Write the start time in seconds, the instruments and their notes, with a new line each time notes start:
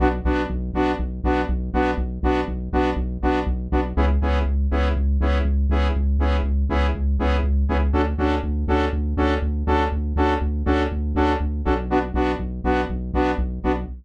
0.00 synth bass 1 B1, lead 2 (sawtooth) B3 D4 F#4
0.25 synth bass 1 B1, lead 2 (sawtooth) B3 D4 F#4
0.50 synth bass 1 B1
0.74 synth bass 1 B1, lead 2 (sawtooth) B3 D4 F#4
0.99 synth bass 1 B1
1.24 synth bass 1 B1, lead 2 (sawtooth) B3 D4 F#4
1.49 synth bass 1 B1
1.74 synth bass 1 B1, lead 2 (sawtooth) B3 D4 F#4
1.98 synth bass 1 B1
2.23 synth bass 1 B1, lead 2 (sawtooth) B3 D4 F#4
2.48 synth bass 1 B1
2.73 synth bass 1 B1, lead 2 (sawtooth) B3 D4 F#4
2.96 synth bass 1 B1
3.22 synth bass 1 B1, lead 2 (sawtooth) B3 D4 F#4
3.46 synth bass 1 B1
3.72 synth bass 1 B1, lead 2 (sawtooth) B3 D4 F#4
3.97 synth bass 1 C#2, lead 2 (sawtooth) B3 C#4 E4 G#4
4.22 synth bass 1 C#2, lead 2 (sawtooth) B3 C#4 E4 G#4
4.46 synth bass 1 C#2
4.71 synth bass 1 C#2, lead 2 (sawtooth) B3 C#4 E4 G#4
4.96 synth bass 1 C#2
5.21 synth bass 1 C#2, lead 2 (sawtooth) B3 C#4 E4 G#4
5.45 synth bass 1 C#2
5.69 synth bass 1 C#2, lead 2 (sawtooth) B3 C#4 E4 G#4
5.96 synth bass 1 C#2
6.19 synth bass 1 C#2, lead 2 (sawtooth) B3 C#4 E4 G#4
6.44 synth bass 1 C#2
6.69 synth bass 1 C#2, lead 2 (sawtooth) B3 C#4 E4 G#4
6.95 synth bass 1 C#2
7.19 synth bass 1 C#2, lead 2 (sawtooth) B3 C#4 E4 G#4
7.43 synth bass 1 C#2
7.69 synth bass 1 C#2, lead 2 (sawtooth) B3 C#4 E4 G#4
7.93 synth bass 1 D2, lead 2 (sawtooth) C#4 D4 F#4 A4
8.18 synth bass 1 D2, lead 2 (sawtooth) C#4 D4 F#4 A4
8.43 synth bass 1 D2
8.68 synth bass 1 D2, lead 2 (sawtooth) C#4 D4 F#4 A4
8.93 synth bass 1 D2
9.17 synth bass 1 D2, lead 2 (sawtooth) C#4 D4 F#4 A4
9.42 synth bass 1 D2
9.67 synth bass 1 D2, lead 2 (sawtooth) C#4 D4 F#4 A4
9.92 synth bass 1 D2
10.16 synth bass 1 D2, lead 2 (sawtooth) C#4 D4 F#4 A4
10.41 synth bass 1 D2
10.66 synth bass 1 D2, lead 2 (sawtooth) C#4 D4 F#4 A4
10.92 synth bass 1 D2
11.15 synth bass 1 D2, lead 2 (sawtooth) C#4 D4 F#4 A4
11.40 synth bass 1 D2
11.65 synth bass 1 B1, lead 2 (sawtooth) C#4 D4 F#4 A4
11.90 lead 2 (sawtooth) B3 D4 F#4
12.14 synth bass 1 B1, lead 2 (sawtooth) B3 D4 F#4
12.39 synth bass 1 B1
12.64 synth bass 1 B1, lead 2 (sawtooth) B3 D4 F#4
12.90 synth bass 1 B1
13.13 synth bass 1 B1, lead 2 (sawtooth) B3 D4 F#4
13.38 synth bass 1 B1
13.64 synth bass 1 B1, lead 2 (sawtooth) B3 D4 F#4